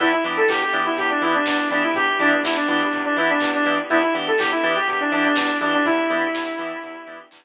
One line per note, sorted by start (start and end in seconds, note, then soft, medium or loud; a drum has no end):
0.00 0.14 E2 loud
0.00 0.08 B3 loud
0.00 3.86 B3 medium
0.00 0.08 D4 loud
0.00 3.86 D4 medium
0.00 0.08 E4 loud
0.00 3.86 E4 medium
0.00 0.12 E4 loud
0.00 0.08 G4 loud
0.00 3.86 G4 medium
0.00 kick medium
0.00 closed hi-hat loud
0.12 0.24 E4 medium
0.23 0.38 E3 medium
0.23 0.42 B3 medium
0.23 0.42 D4 loud
0.23 0.42 E4 medium
0.23 0.42 G4 medium
0.23 open hi-hat medium
0.37 0.48 A4 medium
0.49 0.62 E2 medium
0.49 0.60 G4 medium
0.49 kick medium
0.49 clap medium
0.61 0.81 G4 medium
0.73 0.86 E3 medium
0.73 0.90 B3 medium
0.73 0.90 D4 medium
0.73 0.90 E4 medium
0.73 0.90 G4 loud
0.73 open hi-hat medium
0.85 0.97 E4 medium
0.97 1.11 E2 medium
0.97 1.09 G4 medium
0.97 kick medium
0.97 closed hi-hat loud
1.10 1.22 D4 medium
1.21 1.35 E3 medium
1.21 1.39 B3 medium
1.21 1.39 D4 loud
1.21 1.33 E4 medium
1.21 1.39 E4 medium
1.21 1.39 G4 medium
1.21 open hi-hat medium
1.34 1.46 D4 medium
1.45 1.60 E2 medium
1.45 1.68 D4 medium
1.45 kick medium
1.45 snare loud
1.70 1.84 E3 medium
1.70 1.88 B3 medium
1.70 1.82 D4 medium
1.70 1.88 D4 medium
1.70 1.88 E4 medium
1.70 1.88 G4 loud
1.70 open hi-hat medium
1.83 1.94 E4 medium
1.94 2.09 E2 medium
1.94 2.17 G4 medium
1.94 kick loud
1.94 closed hi-hat medium
2.19 2.33 E3 medium
2.19 2.37 B3 medium
2.19 2.40 D4 medium
2.19 2.37 D4 loud
2.19 2.37 E4 medium
2.19 2.37 G4 medium
2.19 open hi-hat medium
2.43 2.57 E2 medium
2.43 2.56 E4 medium
2.43 kick medium
2.43 snare loud
2.56 2.67 D4 medium
2.68 2.82 E3 medium
2.68 2.85 B3 medium
2.68 3.02 D4 medium
2.68 2.85 D4 medium
2.68 2.85 E4 loud
2.68 2.85 G4 medium
2.68 open hi-hat medium
2.91 3.06 E2 medium
2.91 kick medium
2.91 closed hi-hat medium
3.05 3.16 D4 medium
3.17 3.30 E3 medium
3.17 3.35 B3 loud
3.17 3.35 D4 medium
3.17 3.29 E4 medium
3.17 3.35 E4 medium
3.17 3.35 G4 medium
3.17 open hi-hat medium
3.29 3.49 D4 medium
3.40 3.55 E2 medium
3.40 kick medium
3.40 clap medium
3.54 3.78 D4 medium
3.65 3.79 E3 medium
3.65 3.75 B3 medium
3.65 3.75 D4 medium
3.65 3.75 E4 medium
3.65 3.75 G4 medium
3.65 open hi-hat medium
3.90 4.04 E2 loud
3.90 3.99 B3 loud
3.90 7.45 B3 medium
3.90 3.99 D4 loud
3.90 7.45 D4 medium
3.90 4.02 E4 loud
3.90 3.99 E4 loud
3.90 7.45 E4 medium
3.90 3.99 G4 loud
3.90 7.45 G4 medium
3.90 kick medium
3.90 closed hi-hat medium
4.02 4.14 E4 medium
4.14 4.28 E3 medium
4.14 4.31 B3 medium
4.14 4.31 D4 medium
4.14 4.31 E4 medium
4.14 4.31 G4 medium
4.14 open hi-hat medium
4.27 4.39 A4 medium
4.38 4.52 E2 medium
4.38 4.51 G4 medium
4.38 kick medium
4.38 clap medium
4.51 4.73 E4 medium
4.63 4.77 E3 medium
4.63 4.80 B3 medium
4.63 4.80 D4 loud
4.63 4.80 E4 medium
4.63 4.80 G4 medium
4.63 open hi-hat medium
4.76 4.87 G4 medium
4.88 5.01 E2 medium
4.88 5.00 G4 medium
4.88 kick medium
4.88 closed hi-hat loud
5.00 5.11 D4 medium
5.12 5.25 E3 medium
5.12 5.29 B3 medium
5.12 5.24 D4 medium
5.12 5.29 D4 loud
5.12 5.29 E4 loud
5.12 5.29 G4 medium
5.12 open hi-hat medium
5.24 5.36 D4 medium
5.35 5.50 E2 medium
5.35 5.57 D4 medium
5.35 kick medium
5.35 snare loud
5.61 5.74 E3 medium
5.61 5.78 B3 medium
5.61 5.78 D4 medium
5.61 5.72 D4 medium
5.61 5.78 E4 medium
5.61 5.78 G4 medium
5.61 open hi-hat medium
5.73 5.85 D4 medium
5.85 5.99 E2 medium
5.85 7.19 E4 loud
5.85 kick medium
5.85 closed hi-hat medium
6.10 6.24 E3 medium
6.10 6.27 B3 medium
6.10 6.27 D4 medium
6.10 6.27 E4 medium
6.10 6.27 G4 loud
6.10 open hi-hat medium
6.35 6.48 E2 medium
6.35 kick medium
6.35 snare medium
6.59 6.72 E3 medium
6.59 6.76 B3 loud
6.59 6.76 D4 medium
6.59 6.76 E4 medium
6.59 6.76 G4 medium
6.59 open hi-hat medium
6.83 6.96 E2 medium
6.83 kick medium
6.83 closed hi-hat medium
7.07 7.20 E3 medium
7.07 7.24 B3 medium
7.07 7.24 D4 medium
7.07 7.24 E4 medium
7.07 7.24 G4 medium
7.07 open hi-hat medium
7.31 7.45 E2 medium
7.31 kick medium
7.31 clap loud